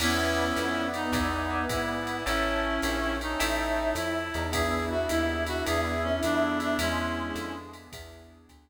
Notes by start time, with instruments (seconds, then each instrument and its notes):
0.00 electric bass (finger) E2, brass section B3, clarinet C#4 E4, electric piano 1 B4 D5 E5 G#5, pad 5 (bowed) B4 D5 E5 G#5, crash, ride
0.56 electric bass (finger) F2, hi-hat pedal, ride
0.94 clarinet D#4, ride
1.12 electric bass (finger) E2, electric piano 1 B4 D5 E5 G#5, pad 5 (bowed) B4 D5 E5 G#5, kick, ride
1.50 electric piano 1 B4 D5 E5 G#5
1.69 electric bass (finger) G#2, clarinet E4, kick, hi-hat pedal, ride
2.07 ride
2.26 electric bass (finger) A1, clarinet C#4 E4, electric piano 1 C#5 E5 G5 A5, pad 5 (bowed) C#5 E5 G5 A5, ride
2.64 brass section C#4
2.82 electric bass (finger) A#1, hi-hat pedal, ride
3.20 brass section C#4, clarinet D#4, ride
3.40 electric bass (finger) A1, brass section E4, electric piano 1 C#5 E5 G5 A5, pad 5 (bowed) C#5 E5 G5 A5, ride
3.95 electric bass (finger) F2, clarinet E4, hi-hat pedal, ride
4.34 electric bass (finger) E2, brass section D#4, ride
4.52 electric piano 1 B3 D4 E4 G#4, pad 5 (bowed) B3 D4 E4 G#4, brass section E4, clarinet G#4, kick, ride
4.90 clarinet F#4
5.09 electric bass (finger) D#2, clarinet E4, hi-hat pedal, ride
5.46 clarinet F#4, ride
5.66 electric bass (finger) E2, pad 5 (bowed) B3 D4 E4 G#4, electric piano 1 B3 D4 E4 G#4, clarinet G#4, ride
6.03 clarinet C#4
6.23 electric bass (finger) F2, clarinet D4, hi-hat pedal, ride
6.60 clarinet D4, ride
6.79 electric bass (finger) E2, brass section G#3, pad 5 (bowed) B3 D4 E4 G#4, clarinet C#4 E4, ride
7.17 brass section G#3
7.35 electric bass (finger) F2, hi-hat pedal, ride
7.73 ride
7.92 electric bass (finger) E2, pad 5 (bowed) B3 D4 E4 G#4, kick, ride
8.49 electric bass (finger) D2, kick, hi-hat pedal, ride